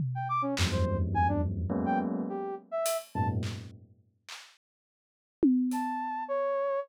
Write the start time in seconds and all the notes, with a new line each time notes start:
0.00 floor tom
0.15 G5
0.29 D6
0.42 C#4
0.57 E2 F2 F#2 G2, clap
0.72 C5
1.14 G#5, high tom
1.28 D4
1.70 F#3 G#3 A#3 B3 C#4
1.86 G5
2.29 G4
2.71 E5
2.86 closed hi-hat
3.15 F#2 G#2 A#2 A5
3.43 clap
4.29 clap
5.43 high tom
5.71 A5, closed hi-hat
6.28 C#5